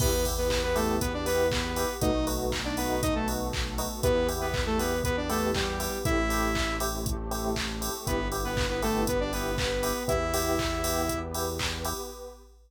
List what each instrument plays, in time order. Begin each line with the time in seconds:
0.00 synth bass 1 E2, pad 5 (bowed) B3 E4 G4, lead 2 (sawtooth) B3 B4, electric piano 1 B3 E4 G4, kick, crash
0.25 electric piano 1 B3 E4 G4, kick, open hi-hat
0.38 lead 2 (sawtooth) B3 B4
0.50 kick, clap
0.63 lead 2 (sawtooth) B3 B4
0.75 lead 2 (sawtooth) A3 A4, electric piano 1 B3 E4 G4, open hi-hat
1.01 lead 2 (sawtooth) B3 B4, pad 5 (bowed) B3 G4 B4, kick, closed hi-hat
1.14 lead 2 (sawtooth) D4 D5
1.26 lead 2 (sawtooth) B3 B4, electric piano 1 B3 E4 G4, open hi-hat
1.51 lead 2 (sawtooth) B3 B4, kick, clap
1.76 electric piano 1 B3 E4 G4, open hi-hat
2.01 synth bass 1 B1, pad 5 (bowed) A3 B3 D#4 F#4, electric piano 1 A3 B3 D#4 F#4, lead 2 (sawtooth) D#4 D#5, kick, closed hi-hat
2.27 electric piano 1 A3 B3 D#4 F#4, open hi-hat
2.52 kick, clap
2.64 lead 2 (sawtooth) D4 D5
2.77 electric piano 1 A3 B3 D#4 F#4, lead 2 (sawtooth) B3 B4, open hi-hat
3.02 pad 5 (bowed) A3 B3 F#4 A4, lead 2 (sawtooth) D#4 D#5, kick, closed hi-hat
3.15 lead 2 (sawtooth) A3 A4
3.28 electric piano 1 A3 B3 D#4 F#4, open hi-hat
3.53 kick, clap
3.78 electric piano 1 A3 B3 D#4 F#4, open hi-hat
4.03 synth bass 1 E2, lead 2 (sawtooth) B3 B4, pad 5 (bowed) B3 E4 G4, electric piano 1 B3 E4 G4, kick, closed hi-hat
4.29 electric piano 1 B3 E4 G4, open hi-hat
4.41 lead 2 (sawtooth) B3 B4
4.54 kick, clap
4.66 lead 2 (sawtooth) A3 A4
4.79 electric piano 1 B3 E4 G4, lead 2 (sawtooth) B3 B4, open hi-hat
5.04 lead 2 (sawtooth) B3 B4, pad 5 (bowed) B3 G4 B4, kick, closed hi-hat
5.17 lead 2 (sawtooth) D4 D5
5.29 lead 2 (sawtooth) A3 A4, electric piano 1 B3 E4 G4, open hi-hat
5.55 lead 2 (sawtooth) G3 G4, kick, clap
5.80 electric piano 1 B3 E4 G4, open hi-hat
6.04 synth bass 1 A1, pad 5 (bowed) A3 C4 E4 G4, electric piano 1 A3 C4 E4 G4, lead 2 (sawtooth) E4 E5, kick, closed hi-hat
6.30 electric piano 1 A3 C4 E4 G4, open hi-hat
6.55 kick, clap
6.80 electric piano 1 A3 C4 E4 G4, open hi-hat
7.06 pad 5 (bowed) A3 C4 G4 A4, kick, closed hi-hat
7.31 electric piano 1 A3 C4 E4 G4, open hi-hat
7.56 kick, clap
7.81 electric piano 1 A3 C4 E4 G4, open hi-hat
8.07 synth bass 1 G1, electric piano 1 B3 E4 G4, pad 5 (bowed) B3 E4 G4, lead 2 (sawtooth) B3 B4, kick, closed hi-hat
8.32 electric piano 1 B3 E4 G4, open hi-hat
8.45 lead 2 (sawtooth) B3 B4
8.57 kick, clap
8.70 lead 2 (sawtooth) B3 B4
8.82 lead 2 (sawtooth) A3 A4, electric piano 1 B3 E4 G4, open hi-hat
9.07 pad 5 (bowed) B3 G4 B4, lead 2 (sawtooth) B3 B4, kick, closed hi-hat
9.20 lead 2 (sawtooth) D4 D5
9.33 electric piano 1 B3 E4 G4, lead 2 (sawtooth) B3 B4, open hi-hat
9.58 lead 2 (sawtooth) B3 B4, kick, clap
9.83 electric piano 1 B3 E4 G4, open hi-hat
10.08 synth bass 1 E2, electric piano 1 B3 E4 G4, pad 5 (bowed) B3 E4 G4, lead 2 (sawtooth) E4 E5, kick, closed hi-hat
10.34 electric piano 1 B3 E4 G4, open hi-hat
10.59 kick, clap
10.84 electric piano 1 B3 E4 G4, open hi-hat
11.09 pad 5 (bowed) B3 G4 B4, kick, closed hi-hat
11.34 electric piano 1 B3 E4 G4, open hi-hat
11.59 kick, clap
11.85 electric piano 1 B3 E4 G4, open hi-hat